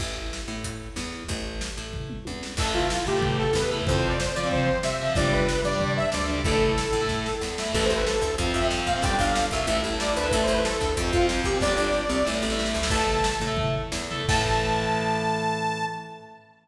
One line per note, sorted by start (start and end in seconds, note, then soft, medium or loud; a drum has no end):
0.00 0.41 A1 medium
0.00 kick medium
0.00 crash medium
0.33 snare medium
0.48 0.89 A2 medium
0.64 kick medium
0.64 closed hi-hat loud
0.96 1.23 E2 medium
0.96 snare medium
1.28 1.70 A1 medium
1.28 kick medium
1.28 closed hi-hat medium
1.61 snare loud
1.77 2.19 A2 medium
1.93 kick medium
1.93 floor tom medium
2.10 mid tom medium
2.25 2.54 E2 medium
2.25 high tom medium
2.43 snare medium
2.57 2.98 A1 medium
2.57 2.84 E3 medium
2.57 2.84 A3 medium
2.57 2.72 A4 medium
2.57 kick loud
2.57 crash loud
2.74 3.06 F4 medium
2.74 floor tom medium
2.90 snare loud
3.07 3.48 A2 medium
3.07 3.37 G4 medium
3.07 floor tom medium
3.16 3.42 E3 medium
3.16 3.42 A3 medium
3.22 kick medium
3.22 floor tom loud
3.39 3.54 A4 medium
3.39 floor tom medium
3.53 3.81 E2 medium
3.53 3.70 B4 medium
3.53 snare loud
3.71 3.84 E3 medium
3.71 3.84 A3 medium
3.71 floor tom medium
3.87 4.30 F2 medium
3.87 4.13 F3 medium
3.87 4.13 C4 medium
3.87 3.97 C5 medium
3.87 kick loud
3.87 floor tom loud
3.98 4.08 C5 medium
4.04 floor tom medium
4.08 4.19 D5 medium
4.19 4.35 C5 medium
4.19 snare loud
4.35 4.77 F3 medium
4.35 4.49 D5 medium
4.35 floor tom medium
4.43 4.69 F3 medium
4.43 4.69 C4 medium
4.51 4.79 C5 medium
4.51 kick medium
4.51 floor tom loud
4.67 floor tom medium
4.83 5.10 C3 medium
4.83 5.13 E5 medium
4.83 snare loud
4.99 5.14 F3 medium
4.99 5.14 C4 medium
4.99 floor tom medium
5.15 5.57 G1 medium
5.15 5.42 G3 medium
5.15 5.42 D4 medium
5.15 5.31 D5 medium
5.15 kick loud
5.15 floor tom loud
5.32 5.61 B4 medium
5.32 floor tom medium
5.49 snare loud
5.64 6.06 G2 medium
5.64 5.93 D5 medium
5.64 floor tom medium
5.73 5.99 G3 medium
5.73 5.99 D4 medium
5.80 kick medium
5.80 floor tom loud
5.97 6.10 E5 medium
5.97 floor tom medium
6.12 6.41 D2 medium
6.12 6.27 D5 medium
6.12 snare loud
6.28 6.41 G3 medium
6.28 6.41 D4 medium
6.28 floor tom medium
6.44 6.86 A1 medium
6.44 6.71 A3 medium
6.44 6.71 E4 medium
6.44 7.35 A4 medium
6.44 kick loud
6.44 floor tom medium
6.61 floor tom medium
6.78 snare loud
6.93 7.34 A2 medium
6.93 floor tom medium
7.01 7.27 A3 medium
7.01 7.27 E4 medium
7.09 kick medium
7.09 snare medium
7.26 snare medium
7.41 7.69 E2 medium
7.41 snare medium
7.58 7.72 A3 medium
7.58 7.72 E4 medium
7.58 snare loud
7.73 7.88 A1 loud
7.73 7.98 E3 medium
7.73 7.98 A3 medium
7.73 7.84 A4 medium
7.73 kick medium
7.73 crash medium
7.85 7.95 C5 medium
7.89 8.17 A1 medium
7.89 closed hi-hat medium
7.96 8.06 B4 medium
8.06 8.35 A4 medium
8.06 snare loud
8.22 8.35 D2 medium
8.22 kick medium
8.22 closed hi-hat medium
8.38 8.52 F2 medium
8.38 8.58 F3 medium
8.38 8.58 C4 medium
8.38 kick medium
8.38 closed hi-hat medium
8.54 8.81 F2 medium
8.54 8.68 E5 medium
8.54 closed hi-hat medium
8.62 8.87 F3 medium
8.62 8.87 C4 medium
8.71 snare loud
8.87 9.01 A#2 medium
8.87 9.02 F5 medium
8.87 kick medium
8.87 closed hi-hat medium
8.96 9.02 F3 medium
8.96 9.02 C4 medium
9.02 9.16 G1 medium
9.02 9.29 G3 medium
9.02 9.29 D4 medium
9.02 9.17 G5 medium
9.02 kick loud
9.02 closed hi-hat medium
9.19 9.47 G1 medium
9.19 9.47 F5 medium
9.19 kick medium
9.19 closed hi-hat medium
9.35 snare loud
9.51 9.66 C2 medium
9.51 9.82 E5 medium
9.51 kick medium
9.51 closed hi-hat medium
9.67 9.81 A1 medium
9.67 9.88 A3 medium
9.67 9.88 E4 medium
9.67 kick medium
9.67 closed hi-hat medium
9.84 10.12 A1 medium
9.84 closed hi-hat medium
9.92 10.18 A3 medium
9.92 10.18 E4 medium
10.00 10.15 D5 medium
10.00 snare loud
10.16 10.30 D2 medium
10.16 10.32 B4 medium
10.16 closed hi-hat medium
10.23 10.30 A3 medium
10.23 10.30 E4 medium
10.32 10.46 A1 medium
10.32 10.58 A3 medium
10.32 10.58 E4 medium
10.32 10.43 A4 medium
10.32 kick medium
10.32 closed hi-hat loud
10.43 10.53 C5 medium
10.47 10.76 A1 medium
10.47 closed hi-hat medium
10.53 10.64 B4 medium
10.64 10.91 A4 medium
10.64 snare loud
10.81 10.94 D2 medium
10.81 kick medium
10.81 closed hi-hat medium
10.97 11.11 F2 medium
10.97 11.16 F3 medium
10.97 11.16 C4 medium
10.97 kick medium
10.97 closed hi-hat loud
11.13 11.40 F2 medium
11.13 11.27 F4 medium
11.13 kick medium
11.13 closed hi-hat medium
11.21 11.47 F3 medium
11.21 11.47 C4 medium
11.29 snare loud
11.44 11.59 A#2 medium
11.44 11.59 G4 medium
11.44 kick medium
11.44 closed hi-hat medium
11.55 11.61 F3 medium
11.55 11.61 C4 medium
11.60 11.76 G1 medium
11.60 11.88 G3 medium
11.60 11.88 D4 medium
11.60 12.31 D5 medium
11.60 kick medium
11.60 snare medium
11.76 12.05 G1 medium
11.76 snare medium
11.93 snare medium
12.09 12.23 C2 medium
12.09 snare medium
12.25 12.41 A1 medium
12.25 12.44 A3 medium
12.25 12.44 E4 medium
12.25 snare medium
12.34 snare medium
12.42 12.69 A1 medium
12.42 snare medium
12.50 12.77 A3 medium
12.50 12.77 E4 medium
12.50 snare medium
12.59 snare medium
12.66 snare medium
12.74 12.88 D2 medium
12.74 snare medium
12.82 12.89 A3 medium
12.82 12.89 E4 medium
12.82 snare loud
12.90 13.33 A1 medium
12.90 13.17 A4 medium
12.90 13.17 E5 medium
12.90 13.37 A5 medium
12.90 kick loud
12.90 crash medium
13.07 floor tom medium
13.24 snare loud
13.40 13.85 A2 medium
13.40 floor tom medium
13.47 13.75 A4 medium
13.47 13.75 E5 medium
13.57 kick medium
13.57 floor tom loud
13.74 floor tom medium
13.92 14.23 E2 medium
13.92 snare loud
14.11 14.25 A4 medium
14.11 14.25 E5 medium
14.11 floor tom medium
14.29 15.85 A2 loud
14.29 15.85 E3 medium
14.29 15.85 A3 medium
14.29 15.85 A5 loud
14.29 kick loud
14.29 crash loud